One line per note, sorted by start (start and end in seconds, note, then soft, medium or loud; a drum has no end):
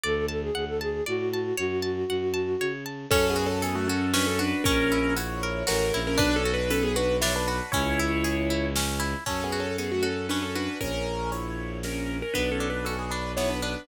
0.03 0.50 D2 loud
0.03 0.26 A4 medium
0.03 0.26 D5 medium
0.28 0.42 A4 medium
0.28 0.51 A5 medium
0.42 0.65 G#4 medium
0.55 1.01 D2 medium
0.55 0.78 F#5 medium
0.68 0.80 A4 medium
0.81 1.04 G#4 medium
0.81 1.04 A5 medium
1.06 1.52 A2 medium
1.06 1.56 F#4 medium
1.06 1.29 D5 medium
1.33 1.57 A5 medium
1.57 2.04 F#2 medium
1.57 2.72 F#4 medium
1.57 1.80 C#5 medium
1.82 2.05 A5 medium
2.09 2.55 F#2 medium
2.09 2.33 F#5 medium
2.34 2.57 A5 medium
2.60 3.06 C#3 medium
2.60 2.84 C#5 medium
2.86 3.09 A5 medium
3.11 4.53 F#2 loud
3.11 3.27 C#4 loud
3.11 3.37 C#4 loud
3.11 3.27 A4 loud
3.11 kick loud
3.11 crash loud
3.30 3.46 B3 medium
3.30 3.46 G#4 loud
3.36 3.61 F#4 medium
3.46 3.62 C#4 medium
3.46 3.62 A4 medium
3.62 3.75 B3 medium
3.62 3.75 G#4 medium
3.62 3.88 A4 medium
3.62 closed hi-hat loud
3.75 3.88 A3 medium
3.75 3.88 F#4 loud
3.88 4.11 C#4 medium
3.88 4.15 F#4 medium
3.88 4.11 A4 medium
4.13 4.39 C#4 medium
4.13 4.26 D4 medium
4.13 4.26 B4 medium
4.13 snare loud
4.27 4.39 C#4 medium
4.27 4.39 A4 medium
4.39 4.63 D4 medium
4.39 4.63 F#4 medium
4.39 4.63 B4 medium
4.64 5.63 A#1 loud
4.64 5.14 C#4 loud
4.64 4.92 C#4 loud
4.64 5.14 A#4 loud
4.64 kick loud
4.64 closed hi-hat loud
4.92 5.17 E4 medium
5.16 5.64 E4 medium
5.16 5.42 F#4 medium
5.16 5.64 C#5 medium
5.16 closed hi-hat loud
5.43 5.69 A#4 medium
5.67 5.91 A1 loud
5.67 6.00 C#4 medium
5.67 5.93 F#4 medium
5.67 6.00 A#4 medium
5.67 snare loud
5.93 6.16 A#1 loud
5.93 6.18 E4 medium
6.07 6.19 C#4 medium
6.07 6.19 A#4 loud
6.18 7.61 B1 loud
6.18 6.43 D4 loud
6.18 6.35 D4 loud
6.18 6.35 B4 loud
6.18 kick loud
6.18 closed hi-hat loud
6.36 6.52 C#4 medium
6.36 6.52 A4 loud
6.45 6.71 F#4 medium
6.54 6.70 D4 medium
6.54 6.70 B4 medium
6.70 6.83 C#4 medium
6.70 6.83 A4 medium
6.70 6.96 B4 medium
6.70 closed hi-hat loud
6.83 6.95 B3 medium
6.83 6.95 G#4 medium
6.96 7.17 D4 medium
6.96 7.22 F#4 medium
6.96 7.17 B4 medium
7.21 7.48 D4 medium
7.21 7.33 E4 medium
7.21 7.33 C#5 loud
7.21 snare loud
7.36 7.47 D4 medium
7.36 7.47 B4 medium
7.48 7.71 D4 medium
7.48 7.72 F#4 medium
7.48 7.71 B4 medium
7.72 9.15 C#2 loud
7.72 7.99 C#4 medium
7.72 8.66 E4 medium
7.72 8.66 C#5 loud
7.72 kick loud
7.72 closed hi-hat loud
7.99 8.25 E4 medium
8.24 8.50 G#4 medium
8.24 closed hi-hat loud
8.50 8.76 E4 medium
8.76 9.02 C#4 medium
8.76 snare loud
9.00 9.24 E4 medium
9.26 10.68 F#2 medium
9.26 10.30 C#4 medium
9.26 9.43 C#4 medium
9.26 9.43 A4 loud
9.26 kick loud
9.26 crash loud
9.44 9.60 B3 medium
9.44 9.60 G#4 medium
9.52 10.02 F#4 medium
9.60 9.76 C#4 medium
9.60 9.76 A4 medium
9.78 9.91 B3 medium
9.78 9.91 G#4 medium
9.78 10.76 A4 medium
9.78 closed hi-hat medium
9.92 10.04 A3 medium
9.92 10.04 F#4 medium
10.03 10.26 C#4 medium
10.03 10.55 F#4 medium
10.03 10.26 A4 medium
10.29 10.79 C#4 medium
10.29 10.41 D4 medium
10.29 10.41 B4 medium
10.29 snare medium
10.42 10.54 C#4 medium
10.42 10.54 A4 medium
10.55 10.78 D4 medium
10.55 10.80 F#4 medium
10.55 10.78 B4 medium
10.81 12.22 A#1 loud
10.81 11.30 C#4 medium
10.81 11.30 A#4 loud
10.81 kick loud
10.81 closed hi-hat loud
11.32 11.79 E4 medium
11.32 11.79 C#5 medium
11.32 closed hi-hat loud
11.83 12.17 C#4 medium
11.83 12.17 A#4 medium
11.83 snare loud
12.22 12.34 C#4 medium
12.22 12.34 A#4 medium
12.34 13.76 B1 loud
12.34 13.37 B3 medium
12.34 12.50 D4 medium
12.34 12.50 B4 loud
12.34 kick medium
12.34 closed hi-hat medium
12.52 12.68 C#4 medium
12.52 12.68 A4 medium
12.60 13.11 D4 medium
12.70 12.86 D4 medium
12.70 12.86 B4 medium
12.85 12.97 C#4 medium
12.85 13.84 F#4 medium
12.85 12.97 A4 medium
12.85 closed hi-hat loud
12.99 13.11 B3 medium
12.99 13.11 G#4 medium
13.11 13.31 D4 medium
13.11 13.62 D4 medium
13.11 13.31 B4 medium
13.37 13.86 B3 medium
13.37 13.49 E4 medium
13.37 13.49 C#5 medium
13.37 snare loud
13.49 13.61 D4 medium
13.49 13.61 B4 medium
13.62 13.87 D4 medium
13.62 13.86 D4 medium
13.62 13.86 B4 medium